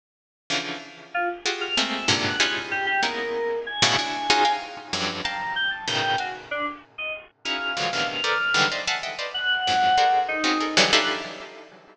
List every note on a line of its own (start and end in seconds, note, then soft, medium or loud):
0.50 0.78 C#3 medium
0.50 0.78 D3 medium
0.50 0.78 E3 medium
0.50 0.78 F3 medium
1.14 1.28 F4 medium
1.46 1.74 F4 medium
1.46 1.74 F#4 medium
1.46 1.74 G4 medium
1.46 1.74 G#4 medium
1.61 1.75 F6 loud
1.77 2.06 G#3 medium
1.77 2.06 A3 medium
1.77 2.06 A#3 medium
1.77 2.06 C4 medium
1.94 2.08 E6 medium
2.08 2.36 G2 medium
2.08 2.36 G#2 medium
2.08 2.36 A#2 medium
2.08 2.36 C3 medium
2.08 2.36 D3 medium
2.25 2.39 F#5 medium
2.39 2.97 C#4 medium
2.39 2.97 D#4 medium
2.39 2.97 E4 medium
2.39 2.97 F4 medium
2.39 2.97 G4 medium
2.39 2.97 G#4 medium
2.39 2.53 F#6 medium
2.71 2.85 G4 loud
2.86 3.01 G4 loud
3.03 3.59 G#3 medium
3.03 3.59 A#3 medium
3.03 3.59 B3 medium
3.03 3.59 C#4 medium
3.03 3.59 D#4 medium
3.03 3.59 E4 medium
3.03 3.59 A#4 medium
3.66 4.52 G#5 medium
3.82 3.96 A2 loud
3.82 3.96 B2 loud
3.82 3.96 C#3 loud
3.82 3.96 D3 loud
3.99 4.27 D4 medium
3.99 4.27 E4 medium
3.99 4.27 F#4 medium
4.30 4.44 C#4 loud
4.30 4.44 D#4 loud
4.30 4.44 F4 loud
4.30 4.44 F#4 loud
4.30 4.44 G#4 loud
4.45 4.87 F5 medium
4.45 4.87 G5 medium
4.45 4.87 G#5 medium
4.45 4.87 A#5 medium
4.93 5.21 F2 medium
4.93 5.21 F#2 medium
4.93 5.21 G2 medium
5.24 5.53 F5 medium
5.24 5.53 G5 medium
5.24 5.53 A5 medium
5.24 5.53 A#5 loud
5.56 5.70 G5 loud
5.71 5.85 A5 medium
5.88 6.16 A2 medium
5.88 6.16 B2 medium
5.88 6.16 C#3 medium
5.88 6.16 D#3 medium
5.88 6.16 G5 medium
6.18 6.34 F#4 medium
6.18 6.32 F5 medium
6.18 6.32 G5 medium
6.18 6.32 G#5 medium
6.51 6.65 D4 medium
6.98 7.12 D#5 medium
7.45 7.74 C#4 medium
7.45 7.74 D#4 medium
7.45 7.74 E4 medium
7.45 7.74 F#4 medium
7.45 7.74 G#4 medium
7.45 7.87 F5 medium
7.77 7.91 C#3 medium
7.77 7.91 D3 medium
7.77 7.91 E3 medium
7.77 7.91 F3 medium
7.77 7.91 F#3 medium
7.77 7.91 G#3 medium
7.93 8.21 A2 medium
7.93 8.21 B2 medium
7.93 8.21 C3 medium
7.93 8.21 D3 medium
7.93 8.21 D#3 medium
7.93 8.21 E3 medium
7.93 8.07 F5 medium
8.08 8.65 F6 medium
8.24 8.38 A4 medium
8.24 8.38 A#4 medium
8.24 8.38 B4 medium
8.24 8.38 C5 medium
8.24 8.38 D5 medium
8.54 8.68 D3 medium
8.54 8.68 D#3 medium
8.54 8.68 E3 medium
8.54 8.68 F#3 medium
8.54 8.68 G3 medium
8.54 8.68 G#3 medium
8.72 8.86 C5 medium
8.72 8.86 D5 medium
8.72 8.86 D#5 medium
8.72 8.86 E5 medium
8.72 8.86 F5 medium
8.88 9.02 E5 loud
8.88 9.02 F5 loud
8.88 9.02 F#5 loud
8.88 9.02 G#5 loud
8.88 9.02 A5 loud
9.03 9.17 D#5 medium
9.03 9.17 E5 medium
9.03 9.17 F#5 medium
9.03 9.17 G5 medium
9.19 9.33 B4 medium
9.19 9.33 C5 medium
9.19 9.33 D5 medium
9.19 9.33 D#5 medium
9.19 9.33 F5 medium
9.34 10.19 F#5 loud
9.67 9.96 F2 medium
9.67 9.96 F#2 medium
9.67 9.96 G#2 medium
9.98 10.40 F#4 medium
9.98 10.40 G#4 medium
9.98 10.40 A4 medium
9.98 10.40 A#4 medium
9.98 10.40 C5 medium
9.98 10.40 D5 medium
10.28 10.85 D#4 medium
10.44 10.58 C4 medium
10.44 10.58 C#4 medium
10.44 10.58 D#4 medium
10.44 10.58 F4 medium
10.44 10.58 F#4 medium
10.44 10.58 G#4 medium
10.60 10.75 G#4 soft
10.60 10.75 A4 soft
10.60 10.75 A#4 soft
10.77 10.91 C#3 loud
10.77 10.91 D3 loud
10.77 10.91 D#3 loud
10.77 10.91 E3 loud
10.77 10.91 F#3 loud
10.77 10.91 G3 loud
10.92 11.21 D4 loud
10.92 11.21 D#4 loud
10.92 11.21 E4 loud
10.92 11.21 F4 loud
10.92 11.21 G4 loud
10.92 11.21 A4 loud
10.92 11.06 F#6 loud